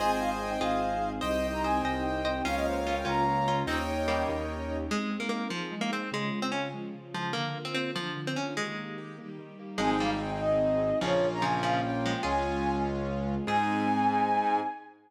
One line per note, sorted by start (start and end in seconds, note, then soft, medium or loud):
0.00 0.56 G#1 medium
0.00 1.21 C4 medium
0.00 1.21 D#4 medium
0.00 0.50 F4 medium
0.00 1.21 G#4 medium
0.00 0.50 G#4 medium
0.00 1.10 C5 loud
0.00 1.10 D#5 loud
0.00 1.10 G#5 loud
0.00 0.11 G#5 medium
0.10 0.20 G5 medium
0.20 0.30 F5 medium
0.40 0.50 G5 medium
0.50 0.60 G5 medium
0.60 1.18 G#1 medium
0.60 1.19 F4 medium
0.60 1.19 G#4 medium
0.60 1.09 F5 medium
1.21 1.80 C2 medium
1.21 2.44 C4 loud
1.21 2.44 D#4 loud
1.21 2.44 G4 medium
1.21 1.48 C5 medium
1.21 2.32 C5 loud
1.21 1.47 D#5 medium
1.21 1.48 D#5 medium
1.21 2.32 D#5 loud
1.21 2.32 G5 loud
1.52 1.62 A#5 medium
1.63 1.84 C5 medium
1.63 1.84 D#5 medium
1.63 1.82 G#5 medium
1.83 2.40 C2 medium
1.83 2.04 C5 medium
1.83 2.04 D#5 medium
1.83 2.03 G5 medium
2.04 2.43 G5 medium
2.25 2.42 C5 medium
2.25 2.42 D#5 medium
2.45 3.02 C#2 medium
2.45 3.67 A#3 medium
2.45 2.73 C#4 medium
2.45 3.67 C#4 loud
2.45 2.73 F4 medium
2.45 3.67 F4 medium
2.45 3.56 A#4 medium
2.45 3.56 C#5 loud
2.45 2.55 F5 medium
2.45 3.56 F5 loud
2.56 2.66 D#5 medium
2.65 2.75 C5 medium
2.85 3.04 C#4 medium
2.85 3.04 F4 medium
2.85 2.95 F5 medium
2.96 3.06 G5 medium
3.05 3.62 C#2 medium
3.05 3.24 C#4 medium
3.05 3.24 F4 medium
3.05 3.59 A#5 medium
3.48 3.66 C#4 medium
3.48 3.66 F4 medium
3.67 4.23 D#2 medium
3.67 4.91 A#3 medium
3.67 3.85 C4 medium
3.67 4.91 C#4 medium
3.67 3.85 D#4 medium
3.67 4.89 D#4 medium
3.67 4.91 G4 medium
3.67 4.77 A#4 loud
3.67 4.77 C#5 loud
3.67 4.77 D#5 loud
3.67 4.77 G5 loud
3.67 4.23 G5 medium
4.08 4.42 G3 medium
4.08 4.42 A#3 medium
4.29 4.85 D#2 medium
4.90 5.49 G#3 medium
4.90 5.08 G#3 medium
4.90 5.17 G#3 loud
4.90 5.51 C4 medium
4.90 5.49 D#4 medium
5.10 5.29 C4 medium
5.20 5.29 A#3 medium
5.29 5.48 A#3 medium
5.29 5.49 D#4 medium
5.49 5.75 F3 loud
5.49 6.10 G#3 medium
5.49 5.69 C4 medium
5.49 6.10 D#4 medium
5.49 6.10 G#4 medium
5.71 5.90 G#3 medium
5.81 5.91 A#3 loud
5.92 6.10 C4 medium
6.12 6.30 C#3 medium
6.12 6.73 C#3 medium
6.12 6.40 G#3 loud
6.12 6.75 G#3 medium
6.12 6.73 F4 medium
6.33 6.51 G#3 medium
6.42 6.52 C4 medium
6.52 6.68 C#4 medium
6.52 6.71 F4 medium
6.73 7.34 C#3 medium
6.73 7.34 F3 medium
6.73 6.92 G#3 medium
6.73 7.33 F4 medium
6.94 7.13 C#3 medium
7.14 7.33 F3 medium
7.14 7.32 G#3 medium
7.33 7.94 D3 medium
7.33 7.53 D3 medium
7.33 7.58 A#3 loud
7.33 7.94 A#3 medium
7.33 7.94 F4 medium
7.55 7.74 A#3 medium
7.65 7.74 C4 loud
7.74 7.91 C4 loud
7.74 7.94 F4 medium
7.96 8.57 D3 medium
7.96 8.20 F3 loud
7.96 8.14 A#3 medium
7.96 8.57 D4 medium
7.96 8.57 F4 medium
8.16 8.34 D3 medium
8.27 8.37 C4 medium
8.36 8.55 A#3 medium
8.36 8.54 C#4 medium
8.57 8.75 D#3 medium
8.57 9.18 D#3 medium
8.57 9.30 G#3 loud
8.57 9.18 A#3 medium
8.57 9.18 G4 medium
8.78 8.96 A#3 medium
8.98 9.16 G4 medium
9.19 9.80 D#3 medium
9.19 9.80 G3 medium
9.19 9.37 A#3 medium
9.19 9.80 G4 medium
9.39 9.57 D#3 medium
9.59 9.78 A#3 medium
9.78 10.91 G#1 medium
9.78 9.97 F3 medium
9.78 9.97 G#3 medium
9.78 10.90 C4 loud
9.78 11.02 C4 loud
9.78 10.90 D#4 loud
9.78 11.02 D#4 medium
9.78 10.90 G#4 loud
9.78 11.02 G#4 medium
9.78 9.90 G#5 medium
9.90 10.00 G5 medium
10.00 10.19 G3 medium
10.00 10.19 A#3 medium
10.00 10.10 F5 medium
10.21 10.30 G5 medium
10.31 10.41 G5 medium
10.40 10.99 D#5 medium
11.01 12.14 A#1 medium
11.01 11.26 C#3 medium
11.01 11.26 F3 medium
11.01 12.12 A#3 loud
11.01 12.23 A#3 loud
11.01 12.12 C#4 loud
11.01 12.23 C#4 loud
11.01 12.12 F4 loud
11.01 12.23 F4 medium
11.01 11.28 C#5 medium
11.33 11.43 A#5 medium
11.42 11.62 C#3 medium
11.42 11.62 F3 medium
11.42 11.62 G#5 medium
11.63 11.82 C#3 medium
11.63 11.82 F3 medium
11.63 11.81 F5 medium
11.82 12.18 G5 medium
12.06 12.23 F3 medium
12.06 12.23 G#3 medium
12.23 13.37 C#2 medium
12.23 13.46 G#3 loud
12.23 13.35 G#3 loud
12.23 13.46 C#4 loud
12.23 13.35 C#4 loud
12.23 12.60 F4 medium
12.23 13.46 F4 medium
12.23 13.35 F4 loud
12.23 12.60 G#4 medium
12.23 12.75 G#5 medium
13.47 14.60 G#2 loud
13.47 14.60 C4 loud
13.47 14.61 C4 medium
13.47 14.60 D#4 loud
13.47 14.61 D#4 medium
13.47 14.60 G#4 medium
13.47 14.61 G#4 loud
13.47 14.60 G#5 loud